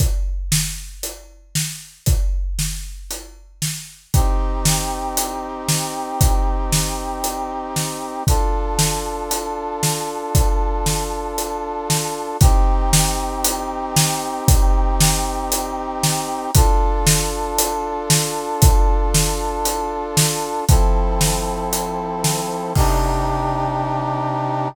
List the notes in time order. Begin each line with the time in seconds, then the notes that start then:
0.00 kick, closed hi-hat
0.52 snare
1.03 closed hi-hat
1.55 snare
2.06 kick, closed hi-hat
2.59 snare
3.11 closed hi-hat
3.62 snare
4.14 C4 D#4 G4, kick, closed hi-hat
4.65 snare
5.17 closed hi-hat
5.69 snare
6.21 kick, closed hi-hat
6.72 snare
7.24 closed hi-hat
7.76 snare
8.27 D4 F4 A4, kick, closed hi-hat
8.79 snare
9.31 closed hi-hat
9.83 snare
10.35 kick, closed hi-hat
10.86 snare
11.38 closed hi-hat
11.90 snare
12.41 C4 D#4 G4, kick, closed hi-hat
12.93 snare
13.44 closed hi-hat
13.96 snare
14.48 kick, closed hi-hat
15.01 snare
15.52 closed hi-hat
16.03 snare
16.55 D4 F4 A4, kick, closed hi-hat
17.07 snare
17.59 closed hi-hat
18.10 snare
18.62 kick, closed hi-hat
19.14 snare
19.65 closed hi-hat
20.17 snare
20.68 F3 C4 E4 A4, kick, closed hi-hat
21.21 snare
21.73 closed hi-hat
22.24 snare
22.75 C3 D4 D#4 G4, kick, crash